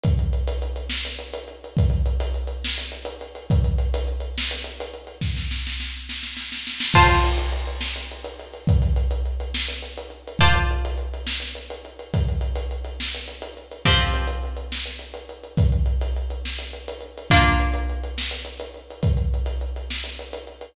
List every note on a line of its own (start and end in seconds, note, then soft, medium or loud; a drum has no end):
0.03 kick loud
0.03 closed hi-hat loud
0.19 closed hi-hat medium
0.33 closed hi-hat medium
0.47 closed hi-hat loud
0.62 closed hi-hat medium
0.76 closed hi-hat medium
0.90 snare loud
1.05 closed hi-hat medium
1.19 closed hi-hat medium
1.34 closed hi-hat loud
1.48 closed hi-hat medium
1.64 closed hi-hat medium
1.77 kick loud
1.77 closed hi-hat medium
1.90 closed hi-hat medium
2.06 closed hi-hat medium
2.20 closed hi-hat loud
2.34 closed hi-hat medium
2.47 closed hi-hat medium
2.64 snare loud
2.78 closed hi-hat medium
2.92 closed hi-hat medium
3.05 closed hi-hat loud
3.21 closed hi-hat medium
3.35 closed hi-hat medium
3.50 kick loud
3.50 closed hi-hat loud
3.64 closed hi-hat medium
3.78 closed hi-hat medium
3.94 closed hi-hat loud
4.07 closed hi-hat medium
4.20 closed hi-hat medium
4.38 snare loud
4.51 closed hi-hat medium
4.64 closed hi-hat medium
4.80 closed hi-hat loud
4.94 closed hi-hat medium
5.07 closed hi-hat medium
5.21 kick medium
5.21 snare medium
5.36 snare medium
5.51 snare medium
5.67 snare medium
5.80 snare medium
6.09 snare medium
6.23 snare medium
6.37 snare medium
6.52 snare medium
6.67 snare medium
6.80 snare loud
6.94 10.34 F4 medium
6.94 10.34 C5 medium
6.94 10.34 A5 medium
6.94 kick loud
6.94 crash loud
7.08 closed hi-hat medium
7.24 closed hi-hat medium
7.38 closed hi-hat medium
7.52 closed hi-hat medium
7.67 closed hi-hat medium
7.81 snare loud
7.96 closed hi-hat medium
8.12 closed hi-hat medium
8.24 closed hi-hat medium
8.39 closed hi-hat medium
8.53 closed hi-hat medium
8.67 kick loud
8.67 closed hi-hat loud
8.82 closed hi-hat medium
8.96 closed hi-hat medium
9.11 closed hi-hat medium
9.25 closed hi-hat medium
9.40 closed hi-hat medium
9.54 snare loud
9.68 closed hi-hat medium
9.82 closed hi-hat medium
9.97 closed hi-hat medium
10.10 closed hi-hat medium
10.27 closed hi-hat medium
10.39 13.79 F4 medium
10.39 13.79 C5 medium
10.39 13.79 D5 medium
10.39 13.79 A5 medium
10.39 kick loud
10.39 closed hi-hat loud
10.54 closed hi-hat medium
10.71 closed hi-hat medium
10.85 closed hi-hat loud
10.98 closed hi-hat medium
11.14 closed hi-hat medium
11.27 snare loud
11.40 closed hi-hat medium
11.55 closed hi-hat medium
11.70 closed hi-hat medium
11.85 closed hi-hat medium
11.99 closed hi-hat medium
12.14 kick medium
12.14 closed hi-hat loud
12.28 closed hi-hat medium
12.41 closed hi-hat medium
12.56 closed hi-hat loud
12.71 closed hi-hat medium
12.85 closed hi-hat medium
13.00 snare loud
13.15 closed hi-hat medium
13.28 closed hi-hat medium
13.42 closed hi-hat loud
13.57 closed hi-hat medium
13.71 closed hi-hat medium
13.85 17.24 F3 medium
13.85 17.24 C4 medium
13.85 17.24 G4 medium
13.85 kick medium
13.85 closed hi-hat medium
14.01 closed hi-hat medium
14.14 closed hi-hat medium
14.27 closed hi-hat medium
14.44 closed hi-hat medium
14.57 closed hi-hat medium
14.72 snare loud
14.85 closed hi-hat medium
14.99 closed hi-hat medium
15.14 closed hi-hat medium
15.29 closed hi-hat medium
15.43 closed hi-hat medium
15.57 kick loud
15.57 closed hi-hat loud
15.72 closed hi-hat medium
15.86 closed hi-hat medium
16.01 closed hi-hat medium
16.16 closed hi-hat medium
16.30 closed hi-hat medium
16.45 snare medium
16.59 closed hi-hat medium
16.73 closed hi-hat medium
16.88 closed hi-hat loud
17.01 closed hi-hat medium
17.18 closed hi-hat medium
17.30 20.69 A#3 medium
17.30 20.69 D4 medium
17.30 20.69 F4 medium
17.30 kick loud
17.30 closed hi-hat medium
17.44 closed hi-hat medium
17.60 closed hi-hat medium
17.74 closed hi-hat medium
17.90 closed hi-hat medium
18.03 closed hi-hat medium
18.18 snare loud
18.31 closed hi-hat medium
18.45 closed hi-hat medium
18.60 closed hi-hat medium
18.74 closed hi-hat medium
18.90 closed hi-hat medium
19.03 kick loud
19.03 closed hi-hat medium
19.17 closed hi-hat medium
19.34 closed hi-hat medium
19.46 closed hi-hat medium
19.61 closed hi-hat medium
19.76 closed hi-hat medium
19.90 snare medium
20.04 closed hi-hat medium
20.19 closed hi-hat medium
20.33 closed hi-hat medium
20.47 closed hi-hat medium
20.61 closed hi-hat medium